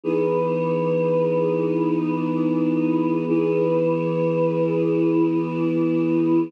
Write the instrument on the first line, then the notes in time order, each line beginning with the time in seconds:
choir aahs
0.04 E3 B3 D#4 G#4
3.28 E3 B3 E4 G#4